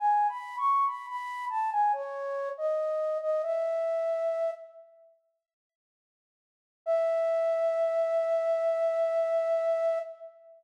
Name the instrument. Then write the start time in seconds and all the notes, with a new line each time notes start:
flute
0.00 G#5
0.29 B5
0.58 C#6
0.86 B5
1.07 B5
1.49 A5
1.72 G#5
1.93 C#5
2.58 D#5
3.21 D#5
3.42 E5
6.86 E5